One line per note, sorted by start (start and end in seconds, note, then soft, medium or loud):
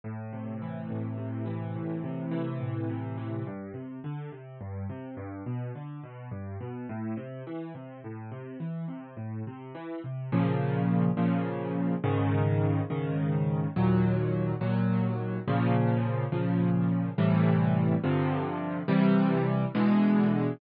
0.04 0.90 A2 medium
0.33 1.17 C3 medium
0.62 1.45 E3 medium
0.90 1.75 A2 medium
1.18 2.03 C3 medium
1.45 2.31 E3 medium
1.75 2.60 A2 medium
2.04 2.89 C3 medium
2.31 3.17 E3 medium
2.60 3.42 A2 medium
2.89 3.44 C3 medium
3.17 3.45 E3 medium
3.47 3.72 G2 medium
3.74 4.00 C3 medium
4.04 4.30 D3 medium
4.32 4.58 C3 medium
4.61 4.86 G2 medium
4.90 5.15 C3 medium
5.17 5.43 G2 medium
5.46 5.72 B2 medium
5.75 6.01 D3 medium
6.03 6.29 B2 medium
6.31 6.57 G2 medium
6.61 6.86 B2 medium
6.89 7.15 A2 medium
7.17 7.43 C3 medium
7.47 7.73 E3 medium
7.75 8.00 C3 medium
8.04 8.30 A2 medium
8.31 8.57 C3 medium
8.60 8.86 E3 medium
8.88 9.14 C3 medium
9.17 9.42 A2 medium
9.47 9.73 C3 medium
9.75 10.00 E3 medium
10.04 10.30 C3 medium
10.32 11.09 A#2 loud
10.32 11.09 C#3 loud
10.32 11.09 F3 loud
11.17 11.94 A#2 medium
11.17 11.94 C#3 loud
11.17 11.94 F3 medium
12.04 12.81 G#2 loud
12.04 12.81 C#3 loud
12.04 12.81 D#3 loud
12.90 13.67 G#2 medium
12.90 13.67 C#3 medium
12.90 13.67 D#3 medium
13.76 14.53 D#2 loud
13.76 14.53 A#2 loud
13.76 14.53 F#3 loud
14.61 15.38 D#2 medium
14.61 15.38 A#2 medium
14.61 15.38 F#3 loud
15.48 16.25 A#2 loud
15.48 16.25 C#3 loud
15.48 16.25 F3 loud
16.32 17.09 A#2 medium
16.32 17.09 C#3 medium
16.32 17.09 F3 medium
17.18 17.95 A2 loud
17.18 17.95 C3 medium
17.18 17.95 E3 loud
17.18 17.95 G3 loud
18.03 18.81 G2 loud
18.03 18.81 C3 loud
18.03 18.81 D3 medium
18.03 18.81 F3 loud
18.88 19.65 C3 loud
18.88 19.65 E3 loud
18.88 19.65 G3 loud
19.75 20.52 B2 loud
19.75 20.52 D3 loud
19.75 20.52 E3 loud
19.75 20.52 G#3 loud